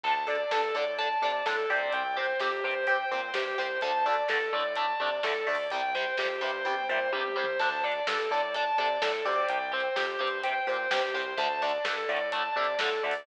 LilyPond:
<<
  \new Staff \with { instrumentName = "Distortion Guitar" } { \time 4/4 \key d \minor \tempo 4 = 127 a''8 d''8 a'8 d''8 a''8 d''8 a'8 d''8 | g''8 c''8 g'8 c''8 g''8 c''8 g'8 c''8 | a''8 d''8 a'8 d''8 a''8 d''8 a'8 d''8 | g''8 c''8 g'8 c''8 g''8 c''8 g'8 c''8 |
a''8 d''8 a'8 d''8 a''8 d''8 a'8 d''8 | g''8 c''8 g'8 c''8 g''8 c''8 g'8 c''8 | a''8 d''8 a'8 d''8 a''8 d''8 a'8 d''8 | }
  \new Staff \with { instrumentName = "Overdriven Guitar" } { \time 4/4 \key d \minor <d' a'>8 <d' a'>8 <d' a'>8 <d' a'>8 <d' a'>8 <d' a'>8 <d' a'>8 <c' g'>8~ | <c' g'>8 <c' g'>8 <c' g'>8 <c' g'>8 <c' g'>8 <c' g'>8 <c' g'>8 <c' g'>8 | <d a>8 <d a>8 <d a>8 <d a>8 <d a>8 <d a>8 <d a>8 <d a>8 | <c g>8 <c g>8 <c g>8 <c g>8 <c g>8 <c g>8 <c g>8 <c g>8 |
<d' a'>8 <d' a'>8 <d' a'>8 <d' a'>8 <d' a'>8 <d' a'>8 <d' a'>8 <c' g'>8~ | <c' g'>8 <c' g'>8 <c' g'>8 <c' g'>8 <c' g'>8 <c' g'>8 <c' g'>8 <c' g'>8 | <d a>8 <d a>8 <d a>8 <d a>8 <d a>8 <d a>8 <d a>8 <d a>8 | }
  \new Staff \with { instrumentName = "Synth Bass 1" } { \clef bass \time 4/4 \key d \minor d,4 g,8 a,4 c8 a,8 d,8 | c,4 f,8 g,4 bes,8 g,8 c,8 | d,4 g,8 a,4 c8 a,8 d,8 | c,4 f,8 g,4 bes,8 g,8 c,8 |
d,4 g,8 a,4 c8 a,8 d,8 | c,4 f,8 g,4 bes,8 g,8 c,8 | d,4 g,8 a,4 c8 a,8 d,8 | }
  \new DrumStaff \with { instrumentName = "Drums" } \drummode { \time 4/4 \tuplet 3/2 { <cymc bd>8 r8 hh8 sn8 r8 hh8 <hh bd>8 r8 hh8 sn8 r8 hh8 } | \tuplet 3/2 { <hh bd>8 r8 hh8 sn8 r8 hh8 <hh bd>8 r8 hh8 sn8 bd8 hh8 } | \tuplet 3/2 { <hh bd>8 r8 hh8 sn8 r8 hh8 <hh bd>8 r8 hh8 sn8 r8 hho8 } | \tuplet 3/2 { <hh bd>8 r8 hh8 sn8 r8 hh8 <bd tommh>8 toml8 tomfh8 tommh8 toml8 tomfh8 } |
\tuplet 3/2 { <cymc bd>8 r8 hh8 sn8 r8 hh8 <hh bd>8 r8 hh8 sn8 r8 hh8 } | \tuplet 3/2 { <hh bd>8 r8 hh8 sn8 r8 hh8 <hh bd>8 r8 hh8 sn8 bd8 hh8 } | \tuplet 3/2 { <hh bd>8 r8 hh8 sn8 r8 hh8 <hh bd>8 r8 hh8 sn8 r8 hho8 } | }
>>